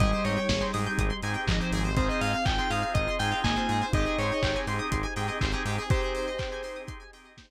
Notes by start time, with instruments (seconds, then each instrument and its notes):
0.00 synth bass 1 G#1, marimba G3, drawbar organ C4 D#4 G4 G#4, pad 2 (warm) C4 D#4 G4 G#4, pizzicato strings G#4, electric piano 2 D#5, kick, closed hi-hat
0.12 pizzicato strings C5
0.24 synth bass 1 G#2, electric piano 2 C#5, pizzicato strings D#5, open hi-hat
0.36 pizzicato strings G5
0.49 synth bass 1 G#1, pizzicato strings G#5, kick, snare
0.61 drawbar organ C4 D#4 G4 G#4, pizzicato strings C6
0.73 synth bass 1 G#2, drawbar organ C4 D#4 G4 G#4, pizzicato strings D#6, open hi-hat
0.86 pizzicato strings G6
0.98 synth bass 1 G#1, pizzicato strings D#6, kick, closed hi-hat
1.10 pizzicato strings C6
1.22 synth bass 1 G#2, drawbar organ C4 D#4 G4 G#4, pizzicato strings G#5, open hi-hat
1.34 pizzicato strings G5
1.47 synth bass 1 G#1, marimba F3, pizzicato strings D#5, kick, clap
1.60 drawbar organ C4 D#4 G4 G#4, pizzicato strings C5
1.72 synth bass 1 G#1, pizzicato strings G#4, open hi-hat
1.84 pizzicato strings C5
1.96 drawbar organ C4 D#4 F4 G#4, marimba C4, pad 2 (warm) C4 D#4 F4 G#4, pizzicato strings G#4, electric piano 2 C5, kick, closed hi-hat
2.09 pizzicato strings C5, electric piano 2 D#5
2.21 synth bass 1 G#2, pizzicato strings D#5, electric piano 2 F5, open hi-hat
2.33 pizzicato strings F5
2.45 synth bass 1 G#1, electric piano 2 G5, pizzicato strings G#5, kick, clap
2.58 drawbar organ C4 D#4 F4 G#4, electric piano 2 G5, pizzicato strings C6
2.70 synth bass 1 G#2, drawbar organ C4 D#4 F4 G#4, electric piano 2 F5, pizzicato strings D#6, open hi-hat
2.82 pizzicato strings F6
2.94 synth bass 1 G#1, electric piano 2 D#5, pizzicato strings D#6, kick, closed hi-hat
3.08 pizzicato strings C6
3.19 synth bass 1 G#2, drawbar organ C4 D#4 F4 G#4, electric piano 2 G5, pizzicato strings G#5, open hi-hat
3.31 pizzicato strings F5
3.44 synth bass 1 G#1, marimba A#3, pizzicato strings D#5, electric piano 2 G#5, kick, clap
3.56 drawbar organ C4 D#4 F4 G#4, pizzicato strings C5
3.69 synth bass 1 G#2, pizzicato strings G#4, open hi-hat
3.81 pizzicato strings C5
3.93 synth bass 1 G#1, pad 2 (warm) C4 D#4 G4 G#4, drawbar organ C4 D#4 G4 G#4, marimba D#4, pizzicato strings G4, electric piano 2 D#5, kick, closed hi-hat
4.05 pizzicato strings G#4
4.18 synth bass 1 G#2, pizzicato strings C5, electric piano 2 C#5, open hi-hat
4.32 pizzicato strings D#5
4.43 synth bass 1 G#1, pizzicato strings G5, kick, clap
4.55 drawbar organ C4 D#4 G4 G#4, pizzicato strings G#5
4.67 synth bass 1 G#2, drawbar organ C4 D#4 G4 G#4, pizzicato strings C6, open hi-hat
4.79 pizzicato strings D#6
4.92 synth bass 1 G#1, pizzicato strings C6, kick, closed hi-hat
5.03 pizzicato strings G#5
5.16 synth bass 1 G#2, drawbar organ C4 D#4 G4 G#4, pizzicato strings G5, open hi-hat
5.28 pizzicato strings D#5
5.41 synth bass 1 G#1, pizzicato strings C5, kick, clap
5.52 drawbar organ C4 D#4 G4 G#4, pizzicato strings G#4
5.65 synth bass 1 G#2, pizzicato strings G4, open hi-hat
5.78 pizzicato strings G#4
5.90 pad 2 (warm) C4 D#4 G4 G#4, drawbar organ C4 D#4 G4 G#4, pizzicato strings G4, marimba G4, electric piano 2 C5, kick, closed hi-hat
6.02 pizzicato strings G#4
6.15 pizzicato strings C5, open hi-hat
6.27 pizzicato strings D#5
6.38 pizzicato strings G5, kick, clap
6.52 drawbar organ C4 D#4 G4 G#4, pizzicato strings G#5
6.63 drawbar organ C4 D#4 G4 G#4, pizzicato strings C6, open hi-hat
6.76 pizzicato strings D#6
6.87 pizzicato strings C6, kick, closed hi-hat
7.00 pizzicato strings G#5
7.13 drawbar organ C4 D#4 G4 G#4, pizzicato strings G5, open hi-hat
7.25 pizzicato strings D#5
7.37 pizzicato strings C5, kick, snare
7.50 pizzicato strings G#4